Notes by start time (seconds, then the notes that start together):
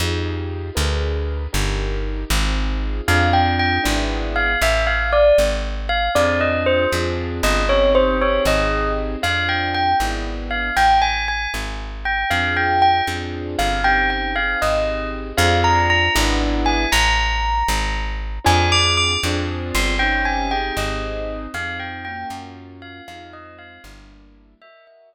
0.00 F2 D#4 F4 G4 G#4
0.75 D2 D4 G#4 A#4 B4
1.53 G1 D4 D#4 G4 A#4
2.30 G#1 C4 D#4 F4 G#4
3.08 F2 C4 D4 F4 G#4 F5
3.33 G5
3.59 G5
3.84 G#1 B3 D4 E4 G#4
4.36 F5
4.62 A1 E5
4.87 F5
5.13 D5
5.38 G#1
5.89 F5
6.15 F2 C4 D4 F4 G#4 D5
6.41 D#5
6.66 C5
6.92 F2 C4 D4 F4 G#4
7.43 G1 D#5
7.69 C4 C#4 D#4 G4 C#5
7.95 C5
8.21 C4 D#4 G4 G#4 C#5
8.45 G#1 D#5
9.22 F2 C4 D4 F4 G#4 F5
9.49 G5
9.74 G5
10.00 G#1 B3 D4 E4 G#4
10.51 F5
10.77 A1 G5
11.02 G#5
11.28 G#5
11.54 G#1
12.05 G5
12.30 F2 C4 D4 F4 G#4 F5
12.57 G5
12.82 G5
13.07 F2 C4 D4 F4 G#4
13.59 G1 F5
13.84 C4 C#4 D#4 G4 G5
14.10 G5
14.35 C4 D#4 G4 G#4 F5
14.62 G#1 D#5
15.37 F2 C4 D4 F4 G#4 F5
15.64 A#5
15.90 A#5
16.15 G#1 B3 D4 E4 G#4
16.66 G#5
16.92 A1 A#5
17.68 G#1
18.44 F2 C4 D4 F4 G#4 G#5
18.72 D6
18.97 D6
19.23 F2 C4 D4 F4 G#4
19.75 G1 C6
19.99 C4 C#4 D#4 G4 G5
20.25 G#5
20.51 C4 D#4 G4 G#4 G5
20.77 G#1 D#5
21.54 F2 C4 D#4 F4 G#4 F5
21.80 G5
22.05 A#3 C#4 F4 F#4 G5
22.30 F#2
22.82 F5
23.08 F2 G#3 C4 D#4 F4 F5
23.33 D#5
23.59 F5
23.84 G1 G3 A#3 D4 E4
24.62 F#4 A#4 D#5 E5
24.87 E5
25.13 D#5